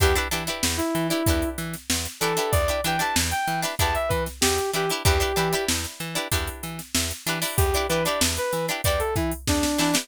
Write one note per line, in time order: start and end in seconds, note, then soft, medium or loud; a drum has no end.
0.00 0.18 E2 medium
0.00 0.13 D4 medium
0.00 0.13 E4 medium
0.00 0.15 G4 loud
0.00 0.13 G4 medium
0.00 0.13 B4 medium
0.00 kick loud
0.00 closed hi-hat loud
0.16 0.28 D4 medium
0.16 0.28 E4 medium
0.16 0.28 G4 medium
0.16 0.28 B4 medium
0.16 closed hi-hat medium
0.31 0.49 E3 medium
0.31 0.44 D4 medium
0.31 0.44 E4 medium
0.31 0.44 G4 medium
0.31 0.44 B4 medium
0.31 closed hi-hat loud
0.47 0.98 D4 medium
0.47 0.98 E4 medium
0.47 0.98 G4 medium
0.47 0.98 B4 medium
0.47 closed hi-hat medium
0.63 0.81 E2 medium
0.63 snare loud
0.77 1.07 E4 medium
0.77 closed hi-hat medium
0.95 1.12 E3 medium
0.95 closed hi-hat medium
1.10 1.23 D4 medium
1.10 1.49 E4 medium
1.10 1.23 E4 medium
1.10 1.23 G4 medium
1.10 1.23 B4 medium
1.10 closed hi-hat medium
1.26 1.44 E2 medium
1.26 1.78 D4 medium
1.26 1.78 E4 medium
1.26 1.78 G4 medium
1.26 1.78 B4 medium
1.26 kick loud
1.26 closed hi-hat loud
1.42 closed hi-hat medium
1.58 1.76 E3 medium
1.58 closed hi-hat medium
1.74 snare soft
1.74 closed hi-hat medium
1.90 2.07 E2 medium
1.90 snare loud
2.05 snare soft
2.05 closed hi-hat medium
2.20 2.39 E3 medium
2.20 2.34 D4 medium
2.20 2.34 E4 medium
2.20 2.34 G4 medium
2.20 2.51 A4 medium
2.20 2.34 B4 medium
2.20 closed hi-hat medium
2.37 2.62 D4 medium
2.37 2.62 E4 medium
2.37 2.62 G4 medium
2.37 2.62 B4 medium
2.37 closed hi-hat medium
2.51 2.70 E2 medium
2.51 2.81 D5 medium
2.51 kick loud
2.51 closed hi-hat loud
2.68 2.81 D4 medium
2.68 2.81 E4 medium
2.68 2.81 G4 medium
2.68 2.81 B4 medium
2.68 closed hi-hat medium
2.84 3.02 E3 medium
2.84 2.97 D4 medium
2.84 2.97 E4 medium
2.84 2.97 G4 medium
2.84 2.97 B4 medium
2.84 3.01 G5 medium
2.84 closed hi-hat loud
2.99 3.50 D4 medium
2.99 3.50 E4 medium
2.99 3.50 G4 medium
2.99 3.50 B4 medium
2.99 3.15 A5 medium
2.99 closed hi-hat medium
3.16 3.33 E2 medium
3.16 snare loud
3.31 3.60 G5 medium
3.31 closed hi-hat medium
3.48 3.65 E3 medium
3.48 closed hi-hat medium
3.62 3.75 D4 medium
3.62 3.75 E4 medium
3.62 3.75 G4 medium
3.62 3.75 B4 medium
3.62 snare soft
3.62 closed hi-hat medium
3.79 3.97 E2 medium
3.79 4.30 D4 medium
3.79 4.30 E4 medium
3.79 4.30 G4 medium
3.79 4.30 B4 medium
3.79 3.95 A5 medium
3.79 kick loud
3.79 closed hi-hat loud
3.95 4.10 E5 medium
3.95 closed hi-hat medium
4.09 4.28 E3 medium
4.09 4.24 B4 medium
4.09 kick medium
4.09 closed hi-hat medium
4.26 snare soft
4.26 closed hi-hat medium
4.41 4.60 E2 medium
4.41 4.71 G4 medium
4.41 snare loud
4.58 closed hi-hat medium
4.73 4.91 E3 medium
4.73 4.86 D4 medium
4.73 4.86 E4 medium
4.73 4.90 G4 medium
4.73 4.86 G4 medium
4.73 4.86 B4 medium
4.73 closed hi-hat medium
4.89 5.03 D4 medium
4.89 5.03 E4 medium
4.89 5.03 G4 medium
4.89 5.03 B4 medium
4.89 closed hi-hat medium
5.04 5.23 E2 loud
5.04 5.18 D4 medium
5.04 5.18 E4 medium
5.04 5.64 G4 medium
5.04 5.18 G4 medium
5.04 5.18 B4 medium
5.04 kick loud
5.04 closed hi-hat loud
5.20 5.33 D4 medium
5.20 5.33 E4 medium
5.20 5.33 G4 medium
5.20 5.33 B4 medium
5.20 closed hi-hat medium
5.36 5.54 E3 medium
5.36 5.49 D4 medium
5.36 5.49 E4 medium
5.36 5.49 G4 medium
5.36 5.49 B4 medium
5.36 closed hi-hat medium
5.53 6.03 D4 medium
5.53 6.03 E4 medium
5.53 6.03 G4 medium
5.53 6.03 B4 medium
5.53 closed hi-hat medium
5.68 5.86 E2 medium
5.68 snare loud
5.84 snare medium
5.84 closed hi-hat medium
6.00 6.18 E3 medium
6.00 closed hi-hat medium
6.15 6.28 D4 medium
6.15 6.28 E4 medium
6.15 6.28 G4 medium
6.15 6.28 B4 medium
6.15 closed hi-hat medium
6.32 6.49 E2 medium
6.32 6.82 D4 medium
6.32 6.82 E4 medium
6.32 6.82 G4 medium
6.32 6.82 B4 medium
6.32 kick loud
6.32 closed hi-hat loud
6.47 closed hi-hat medium
6.63 6.81 E3 medium
6.63 closed hi-hat medium
6.79 snare medium
6.79 closed hi-hat medium
6.95 7.12 E2 medium
6.95 snare loud
7.11 closed hi-hat medium
7.26 7.44 E3 medium
7.26 7.39 D4 medium
7.26 7.39 E4 medium
7.26 7.39 G4 medium
7.26 7.39 B4 medium
7.26 closed hi-hat loud
7.42 7.67 D4 medium
7.42 7.67 E4 medium
7.42 7.67 G4 medium
7.42 7.67 B4 medium
7.42 open hi-hat medium
7.57 7.75 E2 medium
7.57 7.86 G4 medium
7.57 kick loud
7.57 closed hi-hat loud
7.74 7.87 D4 medium
7.74 7.87 E4 medium
7.74 7.87 G4 medium
7.74 7.87 B4 medium
7.74 closed hi-hat medium
7.89 8.07 E3 medium
7.89 8.03 D4 medium
7.89 8.03 E4 medium
7.89 8.03 G4 medium
7.89 8.04 B4 medium
7.89 8.03 B4 medium
7.89 closed hi-hat medium
8.05 8.56 D4 medium
8.05 8.56 E4 medium
8.05 8.56 G4 medium
8.05 8.56 B4 medium
8.05 8.20 D5 medium
8.05 closed hi-hat medium
8.21 8.39 E2 medium
8.21 snare loud
8.37 8.66 B4 medium
8.37 closed hi-hat medium
8.53 8.70 E3 medium
8.53 snare soft
8.53 closed hi-hat medium
8.68 8.81 D4 medium
8.68 8.81 E4 medium
8.68 8.81 G4 medium
8.68 8.81 B4 medium
8.68 closed hi-hat medium
8.84 9.02 E2 medium
8.84 9.36 D4 medium
8.84 9.36 E4 medium
8.84 9.36 G4 medium
8.84 9.36 B4 medium
8.84 9.00 D5 medium
8.84 kick loud
8.84 closed hi-hat loud
8.99 9.14 A4 medium
8.99 closed hi-hat medium
9.16 9.33 E3 medium
9.16 9.31 E4 medium
9.16 kick loud
9.16 closed hi-hat medium
9.31 closed hi-hat medium
9.48 9.65 E2 medium
9.48 9.79 D4 medium
9.48 kick loud
9.48 snare loud
9.63 snare medium
9.78 9.96 E3 medium
9.78 9.91 D4 medium
9.78 9.95 D4 medium
9.78 9.91 E4 medium
9.78 9.91 G4 medium
9.78 9.91 B4 medium
9.78 snare medium
9.94 10.06 D4 medium
9.94 10.06 E4 medium
9.94 10.06 G4 medium
9.94 10.06 B4 medium
9.94 snare loud